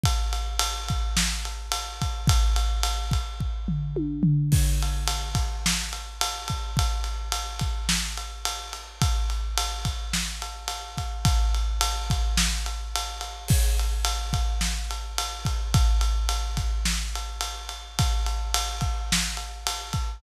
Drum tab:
CC |--------|--------|x-------|--------|
RD |xxxx-xxx|xxxx----|-xxx-xxx|xxxx-xxx|
SD |----o---|--------|----o---|----o---|
T1 |--------|------o-|--------|--------|
FT |--------|-----o-o|--------|--------|
BD |o--o---o|o--oo---|o--o---o|o--o----|

CC |--------|--------|x-------|--------|
RD |xxxx-xxx|xxxx-xxx|-xxx-xxx|xxxx-xxx|
SD |----o---|----o---|----o---|----o---|
T1 |--------|--------|--------|--------|
FT |--------|--------|--------|--------|
BD |o--o---o|o--o----|o--o---o|o--o----|

CC |--------|
RD |xxxx-xxx|
SD |----o---|
T1 |--------|
FT |--------|
BD |o--o---o|